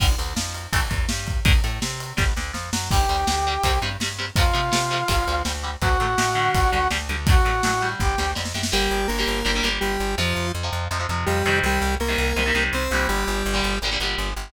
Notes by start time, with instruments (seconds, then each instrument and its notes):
0.00 electric bass (finger) G1, overdriven guitar D3 G3, kick, crash
0.18 electric bass (finger) D2, overdriven guitar D3, ride
0.36 electric bass (finger) F2, overdriven guitar F3, snare
0.55 ride
0.73 electric bass (finger) A1, overdriven guitar E3 A3, kick, ride
0.90 electric bass (finger) E2, overdriven guitar E3, kick, ride
1.09 electric bass (finger) G2, overdriven guitar G3, snare
1.27 kick, ride
1.45 electric bass (finger) D2, overdriven guitar D3 A3, kick, ride
1.64 electric bass (finger) A2, overdriven guitar A3, ride
1.82 electric bass (finger) C3, overdriven guitar C4, snare
2.00 ride
2.17 electric bass (finger) G1, overdriven guitar D3 G3, kick, snare
2.36 electric bass (finger) D2, overdriven guitar D3, snare
2.53 electric bass (finger) F2, overdriven guitar F3, snare
2.73 electric bass (finger) F#2, overdriven guitar F#3, snare
2.90 electric bass (finger) G1, overdriven guitar D3 G3, brass section G4 G5, kick, crash
3.09 electric bass (finger) D2, overdriven guitar D3 G3
3.27 electric bass (finger) D2, overdriven guitar D3 G3, snare
3.47 overdriven guitar D3 G3
3.63 electric bass (finger) C2, overdriven guitar C3 G3, kick, ride
3.82 electric bass (finger) G2, overdriven guitar C3 G3
4.00 electric bass (finger) G2, overdriven guitar C3 G3, snare
4.18 overdriven guitar C3 G3
4.36 electric bass (finger) F2, overdriven guitar C3 F3 A3, brass section F4 F5, kick, ride
4.53 overdriven guitar C3 F3 A3, electric bass (finger) C3
4.72 overdriven guitar C3 F3 A3, electric bass (finger) C3, snare
4.91 overdriven guitar C3 F3 A3
5.08 electric bass (finger) G1, overdriven guitar D3 G3, kick, ride
5.27 electric bass (finger) D2, overdriven guitar D3 G3
5.45 electric bass (finger) D2, overdriven guitar D3 G3, snare
5.63 overdriven guitar D3 G3
5.82 electric bass (finger) D2, overdriven guitar D3 F#3 A3, brass section F#4 F#5, kick, ride
6.00 electric bass (finger) A2, overdriven guitar D3 F#3 A3
6.18 electric bass (finger) A2, overdriven guitar D3 F#3 A3, snare
6.35 overdriven guitar D3 G3
6.54 electric bass (finger) G1, kick, ride
6.72 electric bass (finger) D2, overdriven guitar D3 G3
6.91 electric bass (finger) D2, overdriven guitar D3 G3, snare
7.09 electric bass (finger) D2, overdriven guitar D3 G3
7.27 overdriven guitar D3 F#3 A3, brass section F#4 F#5, kick, ride
7.45 electric bass (finger) A2, overdriven guitar D3 F#3 A3
7.63 electric bass (finger) A2, overdriven guitar D3 F#3 A3, snare
7.81 overdriven guitar D3 G3
8.00 electric bass (finger) G1, brass section G4 G5, kick, snare
8.18 electric bass (finger) D2, overdriven guitar D3 G3, snare
8.35 electric bass (finger) F2, overdriven guitar D3 G3, snare
8.45 snare
8.54 electric bass (finger) F#2, overdriven guitar D3 G3, snare
8.63 snare
8.72 electric bass (finger) G1, overdriven guitar D3 G3 A#3, lead 1 (square) G3 G4
8.91 electric bass (finger) G1
9.08 electric bass (finger) G1, lead 1 (square) A#3 A#4
9.18 overdriven guitar D3 G3 A#3
9.27 electric bass (finger) G1
9.45 electric bass (finger) G1, overdriven guitar D3 G3 A#3
9.55 overdriven guitar D3 G3 A#3
9.63 electric bass (finger) G1, overdriven guitar D3 G3 A#3
9.81 electric bass (finger) G1, lead 1 (square) G3 G4
10.00 electric bass (finger) G1
10.18 electric bass (finger) F2, overdriven guitar C3 F3, lead 1 (square) F3 F4
10.36 electric bass (finger) F2
10.55 electric bass (finger) F2
10.63 overdriven guitar C3 F3
10.73 electric bass (finger) F2
10.91 electric bass (finger) F2, overdriven guitar C3 F3
10.99 overdriven guitar C3 F3
11.09 electric bass (finger) F2, overdriven guitar C3 F3
11.26 electric bass (finger) F2, lead 1 (square) G3 G4
11.45 electric bass (finger) F2, overdriven guitar C3 D#3 G3
11.63 electric bass (finger) C2, lead 1 (square) G3 G4
11.82 electric bass (finger) C2
12.00 electric bass (finger) C2, lead 1 (square) A#3 A#4
12.08 overdriven guitar C3 D#3 G3
12.18 electric bass (finger) C2
12.36 electric bass (finger) C2, overdriven guitar C3 D#3 G3
12.46 overdriven guitar C3 D#3 G3
12.55 electric bass (finger) C2, overdriven guitar C3 D#3 G3
12.73 electric bass (finger) C2, lead 1 (square) C4 C5
12.91 electric bass (finger) C2, overdriven guitar A#2 D3 G3
13.09 electric bass (finger) G1, lead 1 (square) G3 G4
13.27 electric bass (finger) G1
13.46 electric bass (finger) G1
13.54 overdriven guitar A#2 D3 G3
13.64 electric bass (finger) G1
13.82 electric bass (finger) G1, overdriven guitar A#2 D3 G3
13.91 overdriven guitar A#2 D3 G3
14.00 electric bass (finger) G1, overdriven guitar A#2 D3 G3
14.18 electric bass (finger) G1
14.36 electric bass (finger) G1